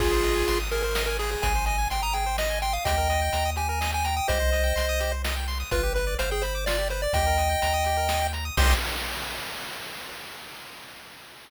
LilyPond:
<<
  \new Staff \with { instrumentName = "Lead 1 (square)" } { \time 3/4 \key c \minor \tempo 4 = 126 <f' aes'>4. bes'16 bes'8 bes'16 aes'16 aes'16 | aes''8 aes''8 g''16 bes''16 g''8 ees''8 g''16 f''16 | <ees'' g''>4. aes''16 aes''8 aes''16 g''16 g''16 | <c'' ees''>2 r4 |
b'8 b'8 c''16 aes'16 c''8 d''8 c''16 d''16 | <ees'' g''>2~ <ees'' g''>8 r8 | c'''4 r2 | }
  \new Staff \with { instrumentName = "Lead 1 (square)" } { \time 3/4 \key c \minor aes'16 c''16 ees''16 aes''16 c'''16 ees'''16 aes'16 c''16 ees''16 aes''16 aes'8~ | aes'16 c''16 ees''16 aes''16 c'''16 ees'''16 aes'16 c''16 ees''16 aes''16 c'''16 ees'''16 | g'16 bes'16 ees''16 g''16 bes''16 ees'''16 g'16 bes'16 ees''16 g''16 bes''16 ees'''16 | g'16 c''16 ees''16 g''16 c'''16 ees'''16 g'16 c''16 ees''16 g''16 c'''16 ees'''16 |
f'16 g'16 b'16 d''16 f''16 g''16 b''16 d'''16 f'16 g'16 b'16 d''16 | g'16 bes'16 ees''16 g''16 bes''16 ees'''16 g'16 bes'16 ees''16 g''16 bes''16 ees'''16 | <g' c'' ees''>4 r2 | }
  \new Staff \with { instrumentName = "Synth Bass 1" } { \clef bass \time 3/4 \key c \minor aes,,4 aes,,2 | aes,,4 aes,,2 | ees,4 ees,2 | c,4 c,2 |
g,,4 g,,2 | ees,4 ees,2 | c,4 r2 | }
  \new DrumStaff \with { instrumentName = "Drums" } \drummode { \time 3/4 <cymc bd>8 hh8 hh8 hh8 sn8 hho8 | <hh bd>8 hh8 hh8 hh8 sn8 hh8 | <hh bd>8 hh8 hh8 hh8 sn8 hh8 | <hh bd>8 hh8 hh8 hh8 sn8 hho8 |
<hh bd>8 hh8 hh8 hh8 sn8 hh8 | <hh bd>8 hh8 hh8 hh8 sn8 hh8 | <cymc bd>4 r4 r4 | }
>>